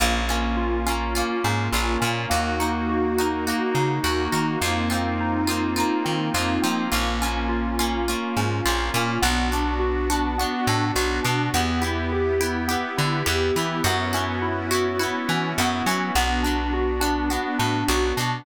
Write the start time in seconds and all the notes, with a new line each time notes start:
0.00 A#1 A#3 C#4 F4
0.29 A#3 C#4 F4
0.57 F4
0.86 A#3 C#4 F4
1.15 A#3 C#4 F4
1.44 G#2 C#4
1.72 A#1 C#4 F4
1.76 A#3
2.00 A#2 C#4 F4
2.05 A#3
2.30 D#2 A#3 D#4 F#4
2.59 A#3 D#4 F#4
2.89 F#4
3.18 A#3 D#4 F#4
3.47 A#3 D#4 F#4
3.75 C#3 D#4
4.04 D#2 A#3 D#4 F#4
4.32 D#3 A#3 D#4 F#4
4.60 F2 A#3 C4 D#4 F4
4.66 A#3
4.90 A#3 C4 D#4 F4
5.20 D#4
5.47 A#3 C4 D#4 F4
5.76 A#3 C4 D#4 F4
6.05 D#3 C4
6.34 F2 A#3 C4 D#4 F4
6.38 A#3
6.62 F3 C4 D#4 F4
6.66 A#3 C4
6.92 A#1 A#3 C#4 F4
7.21 A#3 C#4 F4
7.49 F4
7.79 A#3 C#4 F4
8.08 A#3 C#4 F4
8.37 G#2 C#4
8.66 A#1 A#3 C#4 F4
8.94 A#2 A#3 C#4 F4
9.22 B1 B3 D4 F#4
9.52 B3 D4 F#4
9.79 F#4
10.10 B3 D4 F#4
10.38 B3 D4 F#4
10.67 A2 D4
10.96 B1 B3 D4 F#4
11.23 B2 B3 D4 F#4
11.54 E2 B3 E4 G4
11.81 B3 E4 G4
12.12 G4
12.40 B3 E4 G4
12.68 B3 E4 G4
12.97 D3 E4
13.26 E2 B3 E4 G4
13.56 E3 B3 E4 G4
13.83 F#2 B3 C#4 E4 F#4
13.88 B3
14.13 B3 C#4 E4 F#4
14.42 E4
14.71 B3 C#4 E4 F#4
14.99 B3 C#4 E4 F#4
15.29 E3 C#4
15.58 F#2 B3 C#4 E4 F#4
15.62 B3
15.86 F#3 C#4 E4 F#4
15.91 B3
16.15 B1 B3 D4 F#4
16.43 B3 D4 F#4
16.73 F#4
17.00 B3 D4 F#4
17.30 B3 D4 F#4
17.59 A2 D4
17.88 B1 B3 D4 F#4
18.16 B2 D4 F#4
18.21 B3